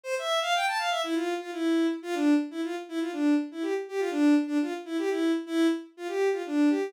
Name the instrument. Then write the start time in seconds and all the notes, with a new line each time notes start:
violin
0.04 C5
0.19 E5
0.41 F5
0.55 G5
0.67 A5
0.78 F5
0.91 E5
1.04 E4
1.14 F4
1.40 F4
1.52 E4
2.02 F4
2.14 D4
2.51 E4
2.64 F4
2.89 E4
3.01 F4
3.12 D4
3.51 E4
3.62 G4
3.88 G4
3.99 F4
4.11 D4
4.47 D4
4.62 F4
4.85 E4
4.98 G4
5.09 E4
5.46 E4
5.97 F4
6.08 G4
6.32 F4
6.46 D4
6.69 G4